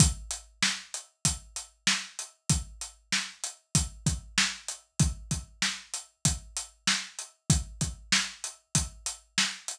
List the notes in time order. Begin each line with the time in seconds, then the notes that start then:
0.00 kick, closed hi-hat
0.31 closed hi-hat
0.62 snare
0.94 closed hi-hat
1.25 kick, closed hi-hat
1.56 closed hi-hat
1.87 snare
2.19 closed hi-hat
2.49 kick, closed hi-hat
2.81 closed hi-hat
3.12 snare
3.44 closed hi-hat
3.75 kick, closed hi-hat
4.06 kick, closed hi-hat
4.38 snare
4.68 closed hi-hat
4.99 kick, closed hi-hat
5.31 kick, closed hi-hat
5.62 snare
5.94 closed hi-hat
6.25 kick, closed hi-hat
6.57 closed hi-hat
6.87 snare
7.19 closed hi-hat
7.50 kick, closed hi-hat
7.81 kick, closed hi-hat
8.12 snare
8.44 closed hi-hat
8.75 kick, closed hi-hat
9.06 closed hi-hat
9.38 snare
9.68 closed hi-hat